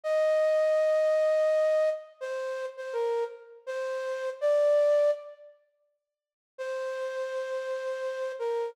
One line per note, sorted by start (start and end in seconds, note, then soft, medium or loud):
0.04 1.90 D#5 loud
2.21 2.66 C5 loud
2.77 2.94 C5 medium
2.93 3.24 A#4 loud
3.67 4.30 C5 loud
4.41 5.11 D5 loud
6.58 8.32 C5 loud
8.39 8.70 A#4 loud